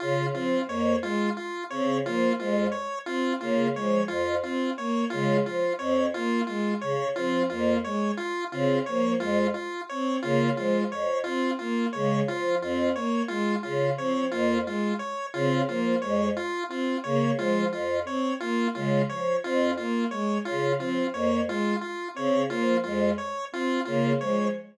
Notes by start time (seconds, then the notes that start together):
0.00 C#3 F4
0.33 F3 C4 F4
0.68 F2 A#3 C#5
1.02 G#3 F4
1.37 F4
1.70 C#3 C4 C#5
2.05 F3 A#3 F4
2.39 F2 G#3 F4
2.72 C#5
3.06 C4 F4
3.40 C#3 A#3 F4
3.74 F3 G#3 C#5
4.08 F2 F4
4.43 C4 F4
4.77 A#3 C#5
5.10 C#3 G#3 F4
5.45 F3 F4
5.78 F2 C4 C#5
6.14 A#3 F4
6.47 G#3 F4
6.81 C#3 C#5
7.15 F3 C4 F4
7.50 F2 A#3 F4
7.84 G#3 C#5
8.17 F4
8.51 C#3 C4 F4
8.86 F3 A#3 C#5
9.20 F2 G#3 F4
9.54 F4
9.89 C4 C#5
10.22 C#3 A#3 F4
10.57 F3 G#3 F4
10.91 F2 C#5
11.24 C4 F4
11.59 A#3 F4
11.93 C#3 G#3 C#5
12.28 F3 F4
12.62 F2 C4 F4
12.95 A#3 C#5
13.28 G#3 F4
13.63 C#3 F4
13.97 F3 C4 C#5
14.31 F2 A#3 F4
14.66 G#3 F4
14.99 C#5
15.34 C#3 C4 F4
15.68 F3 A#3 F4
16.02 F2 G#3 C#5
16.37 F4
16.68 C4 F4
17.04 C#3 A#3 C#5
17.37 F3 G#3 F4
17.72 F2 F4
18.05 C4 C#5
18.40 A#3 F4
18.75 C#3 G#3 F4
19.09 F3 C#5
19.43 F2 C4 F4
19.77 A#3 F4
20.11 G#3 C#5
20.45 C#3 F4
20.78 F3 C4 F4
21.13 F2 A#3 C#5
21.47 G#3 F4
21.81 F4
22.14 C#3 C4 C#5
22.49 F3 A#3 F4
22.84 F2 G#3 F4
23.18 C#5
23.52 C4 F4
23.85 C#3 A#3 F4
24.20 F3 G#3 C#5